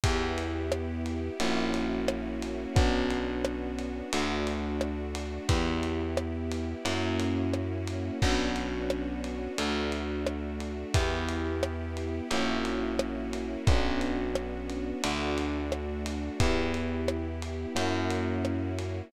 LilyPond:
<<
  \new Staff \with { instrumentName = "Electric Piano 1" } { \time 4/4 \key b \minor \tempo 4 = 88 <b e' g'>2 <ais cis' e' fis'>2 | <b cis' d' fis'>2 <a d' fis'>2 | <b e' g'>2 <ais cis' e' fis'>2 | <b cis' d' fis'>2 <a d' fis'>2 |
<b e' g'>2 <ais cis' e' fis'>2 | <b cis' d' fis'>2 <a d' fis'>2 | <b e' g'>2 <ais cis' e' fis'>2 | }
  \new Staff \with { instrumentName = "Electric Bass (finger)" } { \clef bass \time 4/4 \key b \minor e,2 ais,,2 | b,,2 d,2 | e,2 fis,2 | b,,2 d,2 |
e,2 ais,,2 | b,,2 d,2 | e,2 fis,2 | }
  \new Staff \with { instrumentName = "String Ensemble 1" } { \time 4/4 \key b \minor <b e' g'>2 <ais cis' e' fis'>2 | <b cis' d' fis'>2 <a d' fis'>2 | <b e' g'>2 <ais cis' e' fis'>2 | <b cis' d' fis'>2 <a d' fis'>2 |
<b e' g'>2 <ais cis' e' fis'>2 | <b cis' d' fis'>2 <a d' fis'>2 | <b e' g'>2 <ais cis' e' fis'>2 | }
  \new DrumStaff \with { instrumentName = "Drums" } \drummode { \time 4/4 <bd cymr>8 cymr8 ss8 cymr8 cymr8 cymr8 ss8 cymr8 | <bd cymr>8 cymr8 ss8 cymr8 cymr8 cymr8 ss8 cymr8 | <bd cymr>8 cymr8 ss8 cymr8 cymr8 cymr8 ss8 cymr8 | <cymc bd>8 cymr8 ss8 cymr8 cymr8 cymr8 ss8 cymr8 |
<bd cymr>8 cymr8 ss8 cymr8 cymr8 cymr8 ss8 cymr8 | <bd cymr>8 cymr8 ss8 cymr8 cymr8 cymr8 ss8 cymr8 | <bd cymr>8 cymr8 ss8 cymr8 cymr8 cymr8 ss8 cymr8 | }
>>